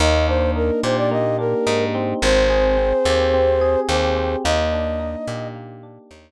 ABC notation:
X:1
M:4/4
L:1/16
Q:1/4=108
K:Eb
V:1 name="Flute"
e2 c2 B2 c d e2 B4 z2 | c12 c4 | e8 z8 |]
V:2 name="Electric Piano 1"
B,2 D2 E2 G2 B,2 D2 E2 C2- | C2 A2 C2 G2 C2 A2 G2 C2 | B,2 D2 E2 G2 B,2 D2 E2 z2 |]
V:3 name="Electric Bass (finger)" clef=bass
E,,6 B,,6 A,,4 | A,,,6 E,,6 E,,4 | E,,6 B,,6 E,,4 |]